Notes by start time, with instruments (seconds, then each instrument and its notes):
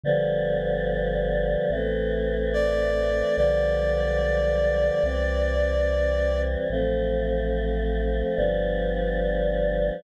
0.03 synth bass 1 G1, choir aahs D3 F3 G3 B3
1.70 synth bass 1 A1, choir aahs E3 A3 C4
2.53 clarinet D5
3.36 synth bass 1 B1, choir aahs D3 F3 G3 B3, clarinet D5
5.03 synth bass 1 C2, choir aahs E3 G3 C4
6.70 synth bass 1 A1, choir aahs F3 A3 C4
8.36 synth bass 1 G1, choir aahs F3 G3 B3 D4